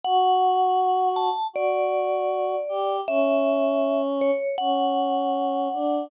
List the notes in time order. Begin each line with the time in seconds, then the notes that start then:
0.04 F#4 F#5
1.16 A5
1.53 F#4 D5
2.69 G4
3.08 C#4 E5
4.21 C#5
4.58 C#4 F#5
5.74 D4